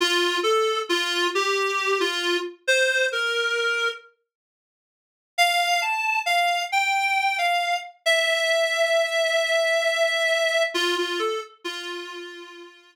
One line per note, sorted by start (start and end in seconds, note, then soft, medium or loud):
0.01 0.37 F4 medium
0.43 0.79 A4 medium
0.89 1.27 F4 medium
1.35 1.99 G4 medium
2.00 2.37 F4 medium
2.68 3.06 C5 medium
3.12 3.89 A#4 medium
5.38 5.81 F5 loud
5.82 6.20 A5 medium
6.26 6.62 F5 medium
6.72 7.36 G5 medium
7.38 7.76 F5 medium
8.06 10.63 E5 medium
10.74 10.96 F4 medium
10.98 11.19 F4 medium
11.19 11.40 A4 medium
11.64 12.94 F4 medium